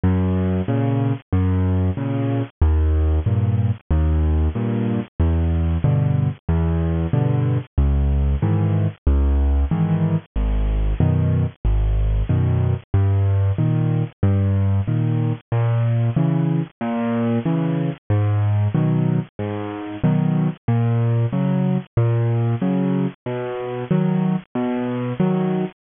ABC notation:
X:1
M:4/4
L:1/8
Q:1/4=93
K:G#m
V:1 name="Acoustic Grand Piano" clef=bass
F,,2 [A,,C,]2 F,,2 [A,,C,]2 | D,,2 [=G,,A,,]2 D,,2 [G,,A,,]2 | E,,2 [=G,,B,,=D,]2 E,,2 [G,,B,,D,]2 | C,,2 [G,,D,E,]2 C,,2 [G,,D,E,]2 |
G,,,2 [F,,B,,D,]2 G,,,2 [F,,B,,D,]2 | =G,,2 [A,,D,]2 G,,2 [A,,D,]2 | A,,2 [C,E,]2 A,,2 [C,E,]2 | G,,2 [B,,D,F,]2 G,,2 [B,,D,F,]2 |
A,,2 [C,F,]2 A,,2 [C,F,]2 | B,,2 [D,F,]2 B,,2 [D,F,]2 |]